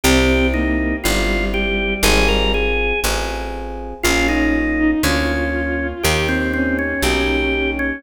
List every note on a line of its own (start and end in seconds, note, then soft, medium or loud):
0.04 0.94 C2 medium
0.04 0.49 C4 medium
0.04 0.94 C4 loud
0.04 0.94 E4 loud
0.04 0.47 G4 medium
0.04 0.94 G4 loud
0.54 0.96 A#3 medium
0.54 0.96 D#4 medium
1.04 1.95 G1 medium
1.04 2.50 G3 medium
1.04 1.94 C4 medium
1.04 1.94 E4 medium
1.04 1.45 F4 medium
1.04 1.94 G4 medium
1.54 1.94 G4 medium
2.03 2.93 G#1 loud
2.03 2.94 C4 loud
2.03 2.94 F4 loud
2.03 2.94 G#4 loud
2.03 2.28 G#4 medium
2.28 2.52 A#4 medium
2.54 3.00 G#4 medium
3.04 3.94 A1 medium
3.04 3.94 C4 medium
3.04 3.94 F4 medium
3.04 3.94 G#4 loud
4.03 4.94 A#1 medium
4.03 4.94 A#3 loud
4.03 4.27 C#4 medium
4.03 4.94 C#4 loud
4.03 4.27 F4 medium
4.03 4.94 F4 loud
4.29 4.53 C#4 medium
4.29 4.91 D#4 medium
4.79 5.02 D#4 medium
5.03 5.93 D2 medium
5.03 5.94 A#3 loud
5.03 5.87 C#4 medium
5.03 5.94 C#4 medium
5.03 5.94 F4 medium
5.03 6.02 F4 medium
6.03 6.94 D#2 medium
6.03 6.94 A#3 loud
6.03 6.94 D#4 loud
6.03 6.27 G4 medium
6.03 6.94 G4 loud
6.29 6.52 C4 medium
6.54 6.77 C4 medium
6.54 8.00 C#4 medium
6.79 7.02 C#4 medium
7.02 7.92 B1 medium
7.02 7.94 A#3 medium
7.02 7.94 D#4 medium
7.02 7.71 G4 medium
7.02 7.94 G4 medium
7.79 8.03 C#4 medium